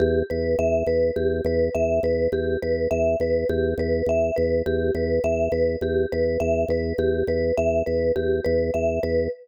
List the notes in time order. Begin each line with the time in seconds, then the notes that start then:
0.00 E2 G4
0.30 E2 B4
0.59 E2 E5
0.87 E2 B4
1.16 E2 G4
1.45 E2 B4
1.75 E2 E5
2.03 E2 B4
2.32 E2 G4
2.62 E2 B4
2.91 E2 E5
3.20 E2 B4
3.49 E2 G4
3.78 E2 B4
4.06 E2 E5
4.36 E2 B4
4.66 E2 G4
4.95 E2 B4
5.24 E2 E5
5.52 E2 B4
5.81 E2 G4
6.12 E2 B4
6.40 E2 E5
6.68 E2 B4
6.98 E2 G4
7.27 E2 B4
7.57 E2 E5
7.86 E2 B4
8.16 E2 G4
8.45 E2 B4
8.74 E2 E5
9.03 E2 B4